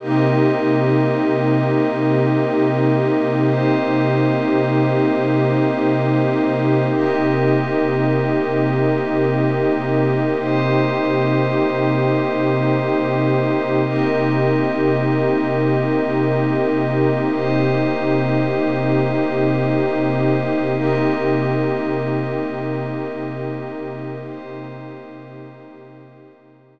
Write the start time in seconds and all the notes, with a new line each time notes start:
0.00 C3 A#3 C4 D#4 G4 A#4 D#5
3.46 C4 G4 C5 D#5
6.92 C3 A#3 C4 D#4 G4 A#4 D#5
10.39 C4 G4 C5 D#5
13.84 C3 A#3 C4 D#4 G4 A#4 D#5
17.31 C4 G4 C5 D#5
20.75 C3 A#3 C4 D#4 G4 A#4 D#5
24.24 C4 G4 C5 D#5